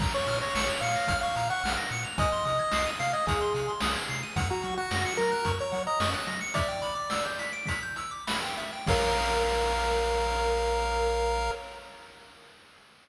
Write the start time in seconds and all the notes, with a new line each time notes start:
0.00 A#1 A#5, kick, crash
0.14 C#5 C#6
0.27 A#2 F6, closed hi-hat
0.41 C#5 A#6
0.55 A#1 C#7, snare
0.69 F7
0.81 A#2 F5 C#7, closed hi-hat
0.96 A#6
1.08 A#1 F6, kick, closed hi-hat
1.21 F5 C#6
1.36 A#2 A#5, closed hi-hat
1.50 F#5 C#6
1.64 A#1 F6, snare
1.77 A#6
1.90 A#2 C#7, closed hi-hat
2.04 F7
2.18 C2 D#5 G#5, kick, closed hi-hat
2.32 C6
2.45 C3 D#6, closed hi-hat
2.59 G#6
2.71 C2 C7, snare
2.86 D#7
3.00 C3 F5 C7, closed hi-hat
3.13 D#5 G#6
3.27 C2 G#4 D#6, kick, closed hi-hat
3.41 C6
3.55 C3 G#5, closed hi-hat
3.68 C6
3.80 C2 D#6, snare
3.96 G#6
4.09 C3 C7, closed hi-hat
4.23 D#7
4.36 F#2 F#5, kick, closed hi-hat
4.50 F#4 A#5
4.62 F#3 C#6, closed hi-hat
4.78 F#4 F#6
4.91 F#2 A#6, snare
5.05 C#7
5.17 F#3 A#4 A#6, closed hi-hat
5.32 F#6
5.45 F#2 C#6, kick, closed hi-hat
5.59 C#5 A#5
5.72 F#3 F#5, closed hi-hat
5.87 D#5 A#5
6.00 F#2 C#6, snare
6.14 F#6
6.27 F#3 A#6, closed hi-hat
6.41 C#7
6.54 D5 E5, kick, closed hi-hat
6.69 G5
6.82 B5, closed hi-hat
6.95 D6
7.10 E6, snare
7.25 G6
7.39 B6, closed hi-hat
7.53 D7
7.66 B6, kick, closed hi-hat
7.83 G6
7.96 E6, closed hi-hat
8.11 D6
8.27 B5, snare
8.42 G5
8.57 E5, closed hi-hat
8.73 G5
8.87 A#1 A#4 C#5 F5, kick, crash